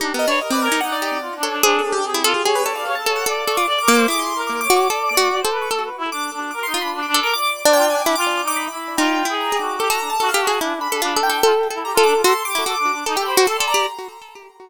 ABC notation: X:1
M:2/4
L:1/16
Q:1/4=147
K:none
V:1 name="Pizzicato Strings"
(3^D2 B,2 =D2 z C2 ^D | z2 G2 z2 A2 | ^G4 z E A z | ^G2 A4 A2 |
A2 A F z2 ^A,2 | E6 ^F2 | (3A4 ^F4 A4 | A2 z6 |
z2 F3 z A2 | z3 D4 E | z8 | (3^D4 E4 ^G4 |
A A3 (3A2 G2 ^G2 | E2 z A (3F2 A2 A2 | (3A4 A4 A4 | ^F z2 E F z3 |
A G2 ^F (3A2 A2 G2 |]
V:2 name="Acoustic Grand Piano"
G2 ^d B (3d2 =d2 ^g2 | ^f d3 z2 ^c2 | (3c2 A2 G2 C3 ^G | G B d f2 a2 ^f |
d'2 ^c' d' z d' d' d' | d' c'2 z (3d'2 d'2 d'2 | d'2 d'2 z3 ^c' | z4 d'2 z2 |
d' c'2 b z d' d' d' | d'2 d'2 (3g2 ^g2 d'2 | d' z d' d' b4 | g4 ^a2 d'2 |
d' ^a2 =a2 f z ^g | z2 b4 g2 | z4 ^a z d' z | c'2 d'6 |
z g b d' c'2 ^a2 |]
V:3 name="Clarinet"
(3D2 ^A2 ^c2 A B A2 | ^D4 (3F2 =D2 D2 | D2 D D ^G2 F2 | ^c3 d c A c2 |
d4 (3d2 ^A2 c2 | (3^G4 ^A4 ^c4 | d d d2 d c B2 | (3A2 B2 E2 D2 D2 |
(3^A2 ^D2 =D2 (3D2 D2 A2 | d3 c (3F2 D2 D2 | (3F4 ^D4 E4 | F3 ^G3 ^F2 |
G ^F D z F A F2 | (3D2 D2 D2 D2 D2 | F z2 E G F D F | A2 G ^F (3A2 D2 D2 |
^D A c2 A =d d2 |]